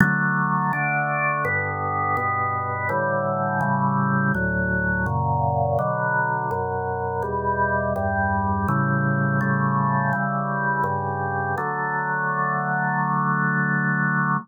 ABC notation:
X:1
M:4/4
L:1/8
Q:1/4=83
K:D
V:1 name="Drawbar Organ"
[D,F,A,]2 [D,A,D]2 [G,,D,B,]2 [G,,B,,B,]2 | [A,,D,E,G,]2 [A,,C,E,G,]2 [D,,A,,F,]2 [F,,^A,,C,]2 | [B,,D,F,]2 [F,,B,,F,]2 [E,,B,,G,]2 [E,,G,,G,]2 | [A,,C,E,G,]2 [A,,C,G,A,]2 [C,E,G,]2 [G,,C,G,]2 |
[D,F,A,]8 |]